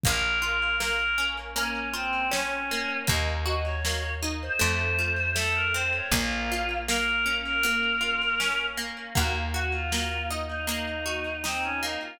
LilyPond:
<<
  \new Staff \with { instrumentName = "Choir Aahs" } { \time 4/4 \key ees \dorian \tempo 4 = 79 bes'8 bes'8 bes'8. r16 des'8 c'8 des'4 | ees''16 r16 ees''16 des''8. r16 c''16 c''4 a'16 bes'16 c''16 des''16 | f'4 bes'8. bes'4.~ bes'16 r8 | ges'16 r16 ges'16 f'8. r16 ees'16 ees'4 c'16 des'16 ees'16 f'16 | }
  \new Staff \with { instrumentName = "Acoustic Guitar (steel)" } { \time 4/4 \key ees \dorian bes8 f'8 bes8 des'8 bes8 f'8 des'8 bes8 | bes8 ges'8 bes8 ees'8 a8 f'8 a8 c'8 | bes8 f'8 bes8 des'8 bes8 f'8 des'8 bes8 | bes8 ges'8 bes8 ees'8 bes8 ges'8 ees'8 bes8 | }
  \new Staff \with { instrumentName = "Electric Bass (finger)" } { \clef bass \time 4/4 \key ees \dorian bes,,1 | ees,2 f,2 | bes,,1 | ees,1 | }
  \new DrumStaff \with { instrumentName = "Drums" } \drummode { \time 4/4 <hh bd>4 sn4 hh4 sn4 | <hh bd>4 sn4 hh4 sn4 | <hh bd>4 sn4 hh4 sn4 | <hh bd>4 sn4 hh4 sn4 | }
>>